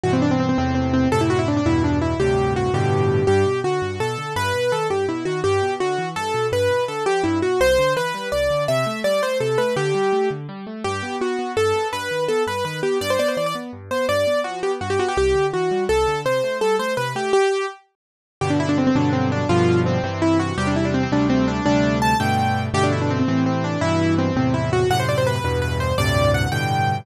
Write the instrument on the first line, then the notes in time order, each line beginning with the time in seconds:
acoustic grand piano
0.03 G2 B2 E3 F#4
0.13 C4
0.22 D4
0.31 C4
0.40 C4
0.49 C4
0.58 E2 A2 C3 C4
0.75 C4
0.93 C4
1.12 F#2 A2 C3 A4
1.21 E4
1.30 F#4
1.39 E4
1.48 D4
1.57 D4
1.66 E2 G2 B2 E4
1.84 D4
2.02 E4
2.20 D2 G2 A2 C3 G4
2.56 F#4
2.74 G2 A2 B2 D3 G4
3.27 G2 G4
3.46 B2
3.64 D3 F#4
3.82 G2
4.00 B2 A4
4.18 D3
4.36 G2 B4
4.54 B2
4.72 D#3 A4
4.90 G2 G4
5.08 B2 E4
5.25 D#3 F#4
5.44 G2 G4
5.62 B2
5.80 D3 F#4
5.98 E3
6.16 G2 A4
6.34 B2
6.52 G2 B4
6.70 B2
6.88 D3 A4
7.06 F3 G4
7.23 G2 E4
7.42 B2 F#4
7.60 C2 C5
7.78 D3
7.96 E3 B4
8.14 G3
8.32 C2 D5
8.50 D3
8.68 C3 E5
8.86 A3
9.04 G3 D5
9.22 A3 C5
9.40 C3 A4
9.58 A3 B4
9.76 D3 G4
9.95 G3
10.13 A3
10.30 D3
10.49 G3
10.67 A3
10.84 G2 G4
11.02 B3
11.20 B3 F#4
11.39 B3
11.57 G2 A4
11.75 B3
11.93 G2 B4
12.11 D#3
12.28 B3 A4
12.47 G2 B4
12.65 D#3 B4
12.83 B3 G4
13.01 G2 D5
13.10 C5
13.19 B3 D5
13.28 C5
13.37 E3 D5
13.46 D5
13.55 B3
13.73 G2
13.91 B3 C5
14.09 G2 D5
14.27 B3
14.44 F3 F#4
14.63 B3 G4
14.81 G2 F#4
14.90 G4
14.99 B3 F#4
15.08 G4
15.17 C2 G4
15.35 D3
15.53 E3 F#4
15.71 G3
15.89 C2 A4
16.07 D3
16.25 C3 C5
16.43 A3
16.61 G3 A4
16.79 A3 C5
16.97 C3 B4
17.15 A3 G4
17.33 G4
18.41 G2 B2 D3 G4
18.50 D4
18.60 E4
18.69 D4
18.78 C4
18.87 C4
18.95 G2 B2 D3 F#3 D4
19.13 C4
19.32 D4
19.49 G2 B2 D3 F3 F4
19.86 C4
20.03 G2 C3 E3 C4
20.22 E4
20.39 F#4
20.58 E2 C3 G3 G4
20.67 D4
20.76 E4
20.85 D4
20.94 C4
21.03 C4
21.12 D2 C3 G3 A3 D4
21.30 C4
21.48 D4
21.66 D2 C3 G3 A3 D4
22.02 A5
22.20 G2 B2 D3 A3 G5
22.74 G2 B2 D3 A3 G4
22.83 D4
22.92 E4
23.01 D4
23.10 C4
23.19 C4
23.28 A2 C3 E3 C4
23.46 C4
23.64 D4
23.81 G2 B2 E3 E4
24.18 C4
24.36 E2 A2 C3 C4
24.54 E4
24.73 F#4
24.90 F#2 A2 C3 F#5
25.00 C5
25.09 D5
25.18 C5
25.27 B4
25.36 B4
25.44 E2 G2 B2 B4
25.62 B4
25.80 C5
25.98 D2 G2 A2 C3 D5
26.34 F#5
26.52 G2 A2 B2 D3 G5